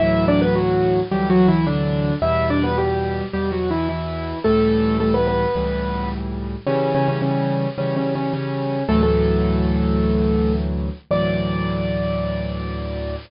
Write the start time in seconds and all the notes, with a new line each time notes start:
0.00 D2 A2 E3 F#3 E4 E5
0.28 D4 D5
0.42 B3 B4
0.56 F#3 F#4
1.11 D2 A2 E3 F#3 G3 G4
1.30 F#3 F#4
1.48 E3 E4
1.67 D3 D4
2.22 E2 B2 G3 E4 E5
2.50 D4 D5
2.64 B3 B4
2.78 G3 G4
3.33 E2 B2 G3 G4
3.52 F#3 F#4
3.71 E3 E4
3.89 E3 E4
4.44 C#2 A2 E3 G3 A3 A4
5.00 A3 A4
5.14 B3 B4
5.27 B3 B4
5.55 C#2 A2 E3 G3
6.67 C#3 E3 G3 C#4
6.95 C#3 C#4
7.08 C#3 C#4
7.22 C#3 C#4
7.78 C#3 E3 G3 C#4
7.96 C#3 C#4
8.15 C#3 C#4
8.34 C#3 C#4
8.89 D2 A2 E3 F#3 A3 A4
9.03 A3 A4
11.11 D2 A2 E3 F#3 D5